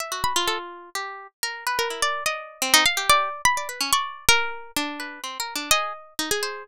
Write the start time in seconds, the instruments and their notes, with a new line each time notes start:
0.00 harpsichord E5
0.12 pizzicato strings F#4
0.24 harpsichord B5
0.36 pizzicato strings F4
0.48 harpsichord A4
0.95 pizzicato strings G4
1.43 pizzicato strings A#4
1.67 pizzicato strings B4
1.79 harpsichord A#4
1.90 pizzicato strings E4
2.02 pizzicato strings D5
2.26 pizzicato strings D5, harpsichord D#5
2.62 pizzicato strings C4
2.74 harpsichord D#4
2.86 harpsichord F5
2.97 pizzicato strings G4
3.10 harpsichord D5
3.45 harpsichord B5
3.57 pizzicato strings D5
3.69 pizzicato strings B4
3.81 pizzicato strings C#4
3.93 pizzicato strings D5, harpsichord C#6
4.29 harpsichord A#4, pizzicato strings A#4
4.76 harpsichord D4
5.00 pizzicato strings B4
5.24 pizzicato strings C4
5.40 pizzicato strings A#4
5.56 pizzicato strings D4
5.71 pizzicato strings G#4, harpsichord D#5
6.19 harpsichord D#4
6.31 harpsichord G#4
6.43 pizzicato strings C5